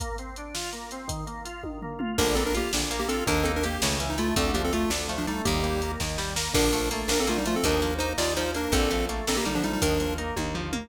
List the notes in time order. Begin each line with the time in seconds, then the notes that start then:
0.00 A#3, kick, closed hi-hat
0.18 C4, closed hi-hat
0.36 D4, closed hi-hat
0.54 F4, snare
0.73 A#3, closed hi-hat
0.91 C4, closed hi-hat
1.08 D#3, kick, closed hi-hat
1.27 A#3, closed hi-hat
1.45 F4, closed hi-hat
1.63 D#3, kick, high tom
1.82 A#3, floor tom
1.99 F4, mid tom
2.18 A#1 D3 A#3 D4 A#4, kick, crash
2.35 A#3 C4 D4 A4, closed hi-hat
2.46 D4 A#4
2.55 A#3 F4 G4, closed hi-hat
2.73 A#1 D3 D4, snare
2.91 A#3, closed hi-hat
2.99 A#3 G4
3.08 C4 D4 F4 A4, closed hi-hat
3.26 D#2 D#3 A#3 D4 A#4, kick, closed hi-hat
3.44 A#3 C4 D#4 A4, closed hi-hat
3.56 D4 A#4
3.63 A#3 G4, closed hi-hat
3.82 C#2 C#3 A3, snare
3.99 E3 C#4, closed hi-hat
4.10 D#4
4.18 A3 E4 F4, closed hi-hat
4.36 D2 D3 A3 C4 A4, kick, closed hi-hat
4.54 F3 A#3 D4 G4, closed hi-hat
4.64 C4 A4
4.73 A3 F4, closed hi-hat
4.90 D2 D3 D4, snare
5.08 F3 A3, closed hi-hat
5.18 F3 D4
5.27 G3 A3 D4 D#4, closed hi-hat
5.45 D#2 D#3 G3 A#3 G4, kick, closed hi-hat
5.63 G3 A#3, closed hi-hat
5.82 A#3 D#4, closed hi-hat
6.00 D#2 D#3 A#3, kick, snare
6.17 G3, snare
6.36 A#3, snare
6.53 A#1 D3 F3 D4 A#4, kick, crash
6.73 F3 A3, closed hi-hat
6.91 A3 A#3, closed hi-hat
7.08 A#1 A#3 D4 A#4, snare
7.20 C4 A4
7.27 D3 A3 A#3 F4, closed hi-hat
7.38 G3 D#4
7.45 F3 A3 F4, closed hi-hat
7.56 C4 A4
7.63 D#2 D#3 F3 D4 A#4, kick, closed hi-hat
7.82 F3 A#3, closed hi-hat
7.98 A#3 D#4 C5, closed hi-hat
8.18 D#2 D#3 A#3 F4 D5, snare
8.36 F3 D#4 C5, closed hi-hat
8.54 A#3 D4 A#4, closed hi-hat
8.72 A#1 D3 F3 C4 A4, kick, closed hi-hat
8.91 F3 A3, closed hi-hat
9.09 A3 A#3, closed hi-hat
9.27 A#1 A#3 C4 D4 A4, snare
9.37 A#3 G4
9.45 D3 G3 A#3 D#4, closed hi-hat
9.55 F3 D4
9.63 F3 G3 A3 D#4, closed hi-hat
9.73 G3 D#4
9.81 D#2 D#3 F3 D4 A#4, kick, closed hi-hat
10.00 F3 A#3, closed hi-hat
10.18 A#3 D#4, closed hi-hat
10.36 D#2 D#3 A#3, kick, high tom
10.55 F3, floor tom
10.72 A#3, mid tom